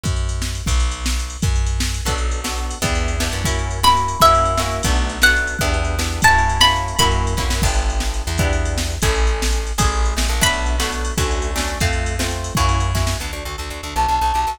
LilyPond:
<<
  \new Staff \with { instrumentName = "Pizzicato Strings" } { \time 5/8 \key b \minor \tempo 4 = 237 r2 r8 | \time 6/8 r2. | \time 5/8 r2 r8 | \time 6/8 r2. |
\time 5/8 r2 r8 | \time 6/8 r4. b''4. | \time 5/8 e''2~ e''8 | \time 6/8 r4. fis''4. |
\time 5/8 r2 r8 | \time 6/8 a''4. b''4. | \time 5/8 b''2~ b''8 | \time 6/8 r2. |
\time 5/8 r2 r8 | \time 6/8 r2. | \time 5/8 r2 r8 | \time 6/8 b''2. |
\time 5/8 r2 r8 | \time 6/8 r2. | \time 5/8 r2 r8 | \time 6/8 \key d \major r2. |
\time 5/8 r2 r8 | }
  \new Staff \with { instrumentName = "Flute" } { \time 5/8 \key b \minor r2 r8 | \time 6/8 r2. | \time 5/8 r2 r8 | \time 6/8 r2. |
\time 5/8 r2 r8 | \time 6/8 r2. | \time 5/8 r2 r8 | \time 6/8 r2. |
\time 5/8 r2 r8 | \time 6/8 r2. | \time 5/8 r2 r8 | \time 6/8 r2. |
\time 5/8 r2 r8 | \time 6/8 r2. | \time 5/8 r2 r8 | \time 6/8 r2. |
\time 5/8 r2 r8 | \time 6/8 r2. | \time 5/8 r2 r8 | \time 6/8 \key d \major r2. |
\time 5/8 a''2~ a''8 | }
  \new Staff \with { instrumentName = "Acoustic Guitar (steel)" } { \time 5/8 \key b \minor r2 r8 | \time 6/8 r2. | \time 5/8 r2 r8 | \time 6/8 <b d' fis' a'>4. <b d' fis' a'>4. |
\time 5/8 <b d' e' g'>4. <b d' e' g'>4 | \time 6/8 <ais cis' e' fis'>4. <ais cis' e' fis'>4. | \time 5/8 <ais cis' e' fis'>4. <ais cis' e' fis'>4 | \time 6/8 <a b d' fis'>4. <a b d' fis'>4. |
\time 5/8 <b d' e' g'>4. <b d' e' g'>4 | \time 6/8 <ais cis' e' fis'>4. <ais cis' e' fis'>4. | \time 5/8 <ais cis' e' fis'>4. <ais cis' e' fis'>4 | \time 6/8 <b d' e' g'>2. |
\time 5/8 <b d' e' g'>2~ <b d' e' g'>8 | \time 6/8 <a cis' e' gis'>2. | \time 5/8 <a cis' e' gis'>2~ <a cis' e' gis'>8 | \time 6/8 <a b d' fis'>4. <a b d' fis'>4. |
\time 5/8 <a cis' d' fis'>4. <a cis' d' fis'>4 | \time 6/8 <a c' f'>4. <a c' f'>4. | \time 5/8 <ais cis' e' fis'>4. <ais cis' e' fis'>4 | \time 6/8 \key d \major b8 d'8 fis'8 a'8 fis'8 d'8 |
\time 5/8 b8 d'8 fis'8 g'8 fis'8 | }
  \new Staff \with { instrumentName = "Electric Bass (finger)" } { \clef bass \time 5/8 \key b \minor fis,2~ fis,8 | \time 6/8 b,,2. | \time 5/8 fis,2~ fis,8 | \time 6/8 b,,2. |
\time 5/8 e,2 fis,8~ | \time 6/8 fis,2. | \time 5/8 fis,2~ fis,8 | \time 6/8 b,,2. |
\time 5/8 e,2~ e,8 | \time 6/8 fis,2. | \time 5/8 fis,4. f,8 fis,8 | \time 6/8 g,,2~ g,,8 e,8~ |
\time 5/8 e,2~ e,8 | \time 6/8 a,,2. | \time 5/8 a,,4. a,,8 ais,,8 | \time 6/8 b,,2. |
\time 5/8 d,2~ d,8 | \time 6/8 f,2. | \time 5/8 fis,2~ fis,8 | \time 6/8 \key d \major d,8 d,8 d,8 d,8 d,8 d,8 |
\time 5/8 b,,8 b,,8 b,,8 b,,8 b,,8 | }
  \new DrumStaff \with { instrumentName = "Drums" } \drummode { \time 5/8 <bd cymr>8 cymr8 cymr8 sn8 cymr8 | \time 6/8 <bd cymr>8 cymr8 cymr8 sn8 cymr8 cymr8 | \time 5/8 <bd cymr>8 cymr8 cymr8 sn8 cymr8 | \time 6/8 <bd cymr>8 cymr8 cymr8 sn8 cymr8 cymr8 |
\time 5/8 <bd cymr>8 cymr8 cymr8 sn8 cymr8 | \time 6/8 <bd cymr>8 cymr8 cymr8 sn8 cymr8 cymr8 | \time 5/8 <bd cymr>8 cymr8 cymr8 sn8 cymr8 | \time 6/8 <bd cymr>8 cymr8 cymr8 sn8 cymr8 cymr8 |
\time 5/8 <bd cymr>8 cymr8 cymr8 sn8 cymr8 | \time 6/8 <bd cymr>8 cymr8 cymr8 sn8 cymr8 cymr8 | \time 5/8 <bd cymr>8 cymr8 cymr8 <bd sn>8 sn8 | \time 6/8 <cymc bd>8 cymr8 cymr8 sn8 cymr8 cymr8 |
\time 5/8 <bd cymr>8 cymr8 cymr8 sn8 cymr8 | \time 6/8 <bd cymr>8 cymr8 cymr8 sn8 cymr8 cymr8 | \time 5/8 <bd cymr>8 cymr8 cymr8 sn8 cymr8 | \time 6/8 <bd cymr>8 cymr8 cymr8 sn8 cymr8 cymr8 |
\time 5/8 <bd cymr>8 cymr8 cymr8 sn8 cymr8 | \time 6/8 <bd cymr>8 cymr8 cymr8 sn8 cymr8 cymr8 | \time 5/8 <bd cymr>8 cymr8 cymr8 <bd sn>8 sn8 | \time 6/8 r4. r4. |
\time 5/8 r4. r4 | }
>>